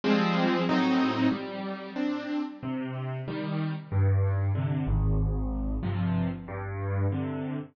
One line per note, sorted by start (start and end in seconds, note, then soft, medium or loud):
0.04 0.62 F3 medium
0.04 0.62 G3 medium
0.04 0.62 G#3 medium
0.04 0.62 C4 loud
0.69 1.27 A2 medium
0.69 1.27 F#3 medium
0.69 1.27 C4 medium
0.69 1.27 D#4 medium
1.32 1.90 G3 medium
1.96 2.41 C4 medium
1.96 2.41 D4 medium
2.63 3.21 C3 medium
3.28 3.73 D#3 medium
3.28 3.73 G3 medium
3.92 4.50 G2 medium
4.55 4.86 C3 medium
4.55 4.86 D3 medium
4.87 5.77 G#1 medium
5.83 6.28 G2 medium
5.83 6.28 C3 medium
5.83 6.28 F3 medium
6.48 7.06 G2 loud
7.12 7.57 C3 medium
7.12 7.57 D3 medium